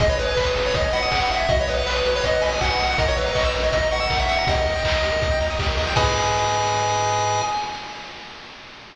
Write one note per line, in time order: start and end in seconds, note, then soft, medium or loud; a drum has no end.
0.00 0.16 G#1 loud
0.00 0.08 G#4 medium
0.00 0.09 D#5 medium
0.00 kick loud
0.00 closed hi-hat medium
0.09 0.17 B4 medium
0.09 0.18 C#5 medium
0.18 0.34 G#1 loud
0.18 0.34 B4 medium
0.18 0.27 D#5 medium
0.18 open hi-hat medium
0.28 0.36 G#5 medium
0.36 0.53 G#1 medium
0.36 0.45 B4 medium
0.36 0.45 B5 medium
0.36 kick medium
0.36 clap loud
0.47 0.55 D#6 medium
0.56 0.72 G#1 loud
0.56 0.64 G#4 soft
0.56 open hi-hat medium
0.66 0.74 B4 medium
0.66 0.75 C#5 medium
0.74 0.90 G#1 loud
0.74 0.83 D#5 medium
0.74 0.92 D#5 medium
0.74 kick medium
0.74 closed hi-hat loud
0.84 0.93 G#5 medium
0.93 1.09 G#1 medium
0.93 1.18 F#5 medium
0.93 1.01 B5 medium
0.93 open hi-hat medium
1.02 1.11 D#6 medium
1.11 1.27 G#1 medium
1.11 1.20 G#4 medium
1.11 kick medium
1.11 clap loud
1.21 1.29 B4 medium
1.21 1.30 F#5 medium
1.30 1.46 G#1 loud
1.30 1.39 D#5 medium
1.30 1.47 E5 medium
1.30 open hi-hat medium
1.40 1.48 G#5 medium
1.49 1.65 B1 loud
1.49 1.57 F#4 medium
1.49 1.58 D#5 medium
1.49 kick loud
1.49 closed hi-hat medium
1.59 1.67 B4 medium
1.59 1.69 C#5 medium
1.67 1.84 B1 medium
1.67 1.86 B4 medium
1.67 1.76 D#5 medium
1.67 open hi-hat medium
1.77 1.85 F#5 medium
1.86 2.02 B1 loud
1.86 2.05 B4 medium
1.86 1.95 B5 medium
1.86 clap loud
1.96 2.04 D#6 medium
2.05 2.21 B1 loud
2.05 2.13 F#4 medium
2.05 2.16 B4 medium
2.05 open hi-hat medium
2.14 2.22 B4 medium
2.14 2.25 C#5 medium
2.23 2.40 B1 loud
2.23 2.32 D#5 medium
2.23 2.42 D#5 medium
2.23 kick medium
2.23 closed hi-hat loud
2.33 2.41 F#5 medium
2.42 2.59 B1 loud
2.42 2.58 G#5 medium
2.42 2.51 B5 medium
2.42 open hi-hat medium
2.51 2.60 D#6 medium
2.61 2.77 B1 loud
2.61 2.69 F#4 medium
2.61 2.85 F#5 medium
2.61 kick medium
2.61 clap loud
2.70 2.78 B4 medium
2.79 2.96 B1 loud
2.79 2.88 D#5 medium
2.79 open hi-hat medium
2.89 2.98 F#5 medium
2.89 2.97 F#5 medium
2.98 3.14 A#1 loud
2.98 3.06 A#4 medium
2.98 3.07 D#5 medium
2.98 kick loud
2.98 closed hi-hat loud
3.08 3.16 C#5 medium
3.08 3.17 C#5 medium
3.17 3.33 A#1 loud
3.17 3.33 B4 medium
3.17 3.25 E5 medium
3.17 open hi-hat medium
3.26 3.34 A#5 medium
3.35 3.51 A#1 medium
3.35 3.43 D#5 medium
3.35 3.44 C#6 medium
3.35 kick medium
3.35 clap loud
3.45 3.53 E6 medium
3.54 3.71 A#1 loud
3.54 3.62 A#4 medium
3.54 open hi-hat medium
3.63 3.72 C#5 medium
3.63 3.71 D#5 medium
3.72 3.88 A#1 loud
3.72 3.88 D#5 medium
3.72 3.81 E5 medium
3.72 kick medium
3.72 closed hi-hat loud
3.82 3.91 A#5 medium
3.91 4.07 A#1 loud
3.91 4.17 F#5 medium
3.91 4.00 C#6 medium
3.91 open hi-hat medium
4.00 4.09 E6 medium
4.10 4.26 A#1 loud
4.10 4.18 A#4 medium
4.10 kick medium
4.10 clap loud
4.19 4.28 C#5 medium
4.19 4.28 E5 medium
4.28 4.44 A#1 medium
4.28 4.37 E5 medium
4.28 4.47 F#5 medium
4.28 open hi-hat medium
4.38 4.47 A#5 medium
4.47 4.63 D#2 loud
4.47 4.56 G4 medium
4.47 5.39 D#5 medium
4.47 kick loud
4.47 closed hi-hat loud
4.56 4.65 A#4 medium
4.66 4.82 D#2 loud
4.66 4.75 D#5 medium
4.66 open hi-hat medium
4.75 4.84 G5 medium
4.84 5.00 D#2 loud
4.84 4.93 A#5 medium
4.84 kick medium
4.84 clap loud
4.94 5.03 D#6 medium
5.03 5.19 D#2 medium
5.03 5.12 G4 medium
5.03 open hi-hat medium
5.12 5.20 A#4 medium
5.21 5.38 D#2 loud
5.21 5.30 D#5 medium
5.21 kick loud
5.21 closed hi-hat medium
5.31 5.39 G5 medium
5.40 5.57 D#2 loud
5.40 5.49 A#5 medium
5.40 open hi-hat medium
5.50 5.58 D#6 medium
5.59 5.75 D#2 loud
5.59 5.68 G4 medium
5.59 kick medium
5.59 clap loud
5.68 5.77 A#4 medium
5.77 5.94 D#2 loud
5.77 5.86 D#5 medium
5.77 open hi-hat medium
5.87 5.95 G5 medium
5.96 7.42 G#2 loud
5.96 7.42 G#4 loud
5.96 7.42 B4 loud
5.96 7.42 D#5 loud
5.96 7.41 G#5 loud
5.96 kick loud
5.96 crash loud